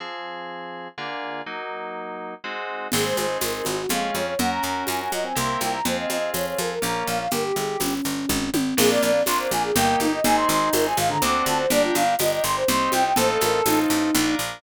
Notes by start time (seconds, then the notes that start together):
0.00 F3 C4 G#4
0.98 D3 A#3 F4 G#4
1.46 F#3 A#3 D#4
2.44 G#3 C4 D#4 F#4
2.92 G#1 G#3 C4 D#4 G#4, crash, low conga, shaker
3.05 C5
3.17 G#1 C5, high conga, shaker
3.41 G#1 A#4, tambourine, high conga, shaker
3.54 A#4
3.65 G#1 F#4, high conga, shaker
3.78 F#4
3.89 F2 G#3 C#4 F4 G#4 F5, low conga, shaker
4.15 F2 C#5, high conga, shaker
4.27 C#5
4.39 F#2 C#4 F#4 A#4 F#5, low conga, shaker
4.51 A#5
4.63 F#2 A#5, shaker
4.87 F#2 G#5, tambourine, high conga, shaker
5.00 G#5
5.12 F#2 D#5, high conga, shaker
5.24 C4 G#5
5.35 C2 A#3 C4 E4 G4 A#4 C6, low conga, shaker
5.60 C2 G5, high conga, shaker
5.73 A#5
5.85 F2 C4 F4 G#4 C5, low conga, shaker
5.98 D#5
6.10 F2 D#5, high conga, shaker
6.34 F2 C#5, tambourine, high conga, shaker
6.46 C#5
6.58 F2 A#4, high conga, shaker
6.71 A#4
6.82 A#1 A#3 C#4 F4 A#5, low conga, shaker
7.07 A#1 F5, shaker
7.20 F5
7.31 G1 G4 A#4, low conga, shaker
7.44 G4
7.56 G1 G#4, shaker
7.80 G1 C#4, tambourine, high conga, shaker
8.04 G1, shaker
8.29 G#1, kick, high tom
8.54 G#1, high tom
8.77 A#1 A#3 D4 F4 G#4, crash, low conga, shaker
8.90 D5
9.02 A#1 D5, shaker
9.26 A#1 A#3 D4 F4 C6, tambourine, high conga, shaker
9.39 C5
9.51 A#1 G#5, high conga, shaker
9.63 G#4
9.75 G1 A#3 D#4 G4 G5, low conga, shaker
10.00 G1 D#4, high conga, shaker
10.12 D#5
10.24 G#1 C4 D#4 G#4 G#5, low conga, shaker
10.37 C6
10.48 G#1 C6, shaker
10.73 G#1 C4 D#4 G#4 A#4, tambourine, high conga, shaker
10.85 G#5
10.97 G#1 F5, high conga, shaker
11.10 D3 A#5
11.22 D2 C4 D4 F#4 A4 D6, low conga, shaker
11.46 D2 A5, high conga, shaker
11.59 C5
11.70 G1 D4 G4 A#4 D5, low conga, shaker
11.83 F4
11.95 G1 F5, high conga, shaker
12.19 G1 D4 G4 A#4 D#5, tambourine, high conga, shaker
12.32 D#5
12.44 G1 C6, shaker
12.56 C5
12.68 C2 C4 D#4 G4 C6, low conga, shaker
12.92 C2 G5, high conga, shaker
13.05 G5
13.16 A1 C4 D#4 F4 A4 C5, low conga, shaker
13.29 A4
13.41 A1 A#4, high conga, shaker
13.66 A1 C4 D#4 F4 A4, tambourine, high conga, shaker
13.90 A1, shaker
14.15 A#1 D4 F4 A#4, low conga, shaker
14.39 A#1, shaker